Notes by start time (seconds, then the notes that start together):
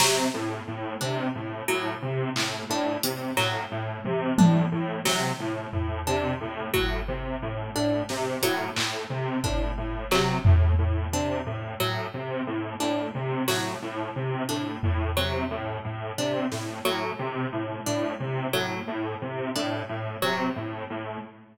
0.00 C3 F#3, snare
0.34 A2
0.68 A2
1.01 C3 D4
1.35 A2
1.68 A2 F#3
2.02 C3
2.36 A2, clap
2.69 A2 D4
3.03 C3, closed hi-hat
3.37 A2 F#3, clap
3.71 A2
4.04 C3, high tom
4.38 A2 D4, high tom
4.72 A2
5.05 C3 F#3, snare
5.40 A2
5.73 A2, floor tom
6.07 C3 D4
6.41 A2
6.74 A2 F#3, kick
7.08 C3
7.42 A2
7.75 A2 D4
8.09 C3, snare
8.42 A2 F#3, closed hi-hat
8.76 A2, clap
9.10 C3
9.44 A2 D4, kick
9.77 A2
10.11 C3 F#3, clap
10.45 A2, floor tom
10.79 A2
11.12 C3 D4
11.46 A2
11.80 A2 F#3
12.14 C3
12.47 A2
12.80 A2 D4, cowbell
13.15 C3
13.48 A2 F#3, snare
13.82 A2
14.16 C3
14.49 A2 D4
14.83 A2, floor tom
15.17 C3 F#3
15.51 A2
15.84 A2
16.18 C3 D4
16.51 A2, snare
16.85 A2 F#3
17.19 C3
17.52 A2
17.86 A2 D4
18.20 C3
18.53 A2 F#3
18.87 A2
19.22 C3
19.55 A2 D4
19.89 A2
20.22 C3 F#3
20.56 A2
20.90 A2